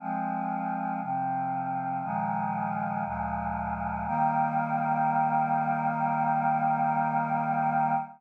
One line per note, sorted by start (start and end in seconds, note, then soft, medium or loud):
0.00 1.00 F3 medium
0.00 1.00 G#3 medium
0.00 1.00 C4 medium
1.01 2.02 C3 medium
1.01 2.02 F3 medium
1.01 2.02 C4 medium
2.03 3.04 A#2 medium
2.03 3.04 D#3 medium
2.03 3.04 F3 medium
2.03 3.04 G#3 medium
3.05 4.06 D2 medium
3.05 4.06 A#2 medium
3.05 4.06 F3 medium
3.05 4.06 G#3 medium
4.06 7.95 D#3 loud
4.06 7.95 G3 medium
4.06 7.95 A#3 loud